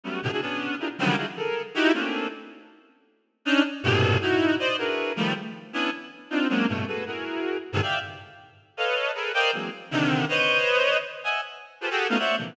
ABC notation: X:1
M:3/4
L:1/16
Q:1/4=158
K:none
V:1 name="Clarinet"
[_G,=G,A,B,_D]2 [A,,B,,C,=D,] [=DE_G_A] [B,_D=D]4 [DEF=GA_B] z [_D,=D,_E,F,_G,=G,]2 | [D_E=EF_G_A] z [A=A_B]3 z [_E=EG=G]2 [A,_B,C_D=D]4 | z12 | [_D=D_E]2 z2 [G,,A,,_B,,=B,,C,]4 [E=E_G]4 |
[cd_e]2 [D=E_G_A_B=B]4 [_E,F,=G,=A,]2 z4 | [B,_D=DE]2 z4 [CD_EF]2 [_G,_A,_B,C_D=D]2 [=G,,=A,,=B,,]2 | [_G_A=AB]2 [EG_A_B]6 z [=G,,_A,,_B,,C,D,_E,] [d=efg]2 | z8 [AB_d_ef]4 |
[_A=A_B=B]2 [_Bcd_efg]2 [=E,_G,_A,_B,C]2 z2 [C,D,_E,]4 | [Bc_d_e]8 z2 [e=e_g_a]2 | z4 [FG_A=ABc] [_G=G_A=A]2 [A,B,_D_EF] [c_d=d=e_g]2 [_B,,C,D,E,F,]2 |]